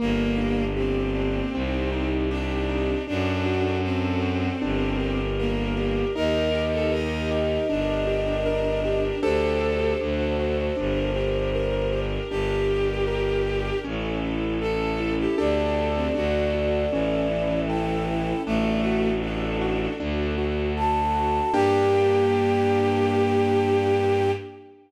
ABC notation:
X:1
M:4/4
L:1/16
Q:1/4=78
K:Gm
V:1 name="Flute"
z16 | z16 | e16 | c16 |
z16 | d12 g4 | z12 a4 | g16 |]
V:2 name="Violin"
B,4 C8 D4 | D4 C8 B,4 | B3 A e2 z2 D8 | A4 z12 |
G8 z4 A3 G | D3 C ^F2 z2 =E,8 | A,4 D4 z8 | G16 |]
V:3 name="Acoustic Grand Piano"
B,2 D2 G2 D2 C2 E2 G2 E2 | D2 ^F2 A2 F2 D2 G2 B2 G2 | E2 G2 B2 G2 D2 G2 B2 G2 | [DGA]4 D2 ^F2 D2 G2 B2 G2 |
D2 G2 B2 G2 ^C2 =E2 A2 E2 | [DGA]4 D2 ^F2 ^C2 =E2 A2 E2 | D2 ^F2 A2 F2 D2 F2 A2 F2 | [B,DG]16 |]
V:4 name="Violin" clef=bass
G,,,8 C,,8 | ^F,,8 G,,,8 | E,,8 G,,,8 | D,,4 D,,4 G,,,8 |
G,,,8 A,,,8 | D,,4 D,,4 A,,,8 | A,,,8 D,,8 | G,,16 |]
V:5 name="String Ensemble 1"
[B,DG]8 [CEG]8 | [D^FA]8 [DGB]8 | [EGB]8 [DGB]8 | [DGA]4 [D^FA]4 [DGB]8 |
[DGB]8 [^C=EA]8 | [DGA]4 [D^FA]4 [^C=EA]8 | [D^FA]8 [DFA]8 | [B,DG]16 |]